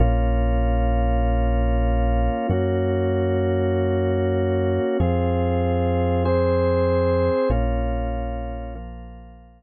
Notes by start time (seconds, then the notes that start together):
0.00 A#1 A#3 C#4 F4
2.49 F#2 A#3 C#4 F#4
5.00 F2 C4 F4 G#4
6.25 C4 G#4 C5
7.50 A#1 A#3 C#4 F4
8.75 F3 A#3 F4